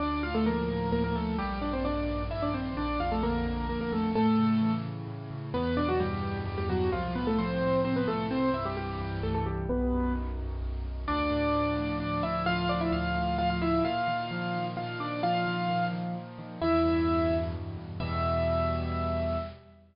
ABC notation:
X:1
M:3/4
L:1/16
Q:1/4=130
K:Dm
V:1 name="Acoustic Grand Piano"
[Dd]2 [Ff] [A,A] [B,B]4 [B,B] [B,B] [A,A]2 | [G,G]2 [Dd] [Cc] [Dd]4 [Ee] [Dd] [Cc]2 | [Dd]2 [Ff] [A,A] [B,B]4 [B,B] [B,B] [A,A]2 | [A,A]6 z6 |
[K:Em] [B,B]2 [Dd] [F,F] [G,G]4 [G,G] [G,G] [F,F]2 | [=F,=F]2 [B,B] [A,A] [Cc]4 [Cc] [B,B] [A,A]2 | [Cc]2 [Ee] [G,G] [G,G]4 [A,A] [A,A] [G,G]2 | [B,B]4 z8 |
[K:Dm] [Dd]8 [Dd]2 [Ee]2 | [Ff]2 [Dd] [Ee] [Ff]4 [Ff] [Ff] [Ee]2 | [Ff]8 [Ff]2 [Dd]2 | [Ff]6 z6 |
[K:Em] [Ee]8 z4 | e12 |]
V:2 name="Acoustic Grand Piano" clef=bass
D,,2 A,,2 F,2 A,,2 D,,2 A,,2 | B,,,2 G,,2 _E,2 G,,2 B,,,2 G,,2 | B,,,2 F,,2 D,2 F,,2 B,,,2 F,,2 | A,,2 ^C,2 E,2 C,2 A,,2 C,2 |
[K:Em] E,,2 B,,2 G,,2 B,,2 E,,2 B,,2 | C,,2 A,,2 =F,2 A,,2 C,,2 A,,2 | C,,2 G,,2 E,2 G,,2 C,,2 G,,2 | B,,,2 F,,2 ^D,2 F,,2 B,,,2 F,,2 |
[K:Dm] D,,2 A,,2 F,2 A,,2 D,,2 A,,2 | F,2 A,,2 D,,2 A,,2 F,2 A,,2 | B,,2 _E,2 F,2 E,2 B,,2 E,2 | F,2 _E,2 B,,2 E,2 F,2 E,2 |
[K:Em] E,,2 G,,2 B,,2 G,,2 E,,2 G,,2 | [E,,B,,G,]12 |]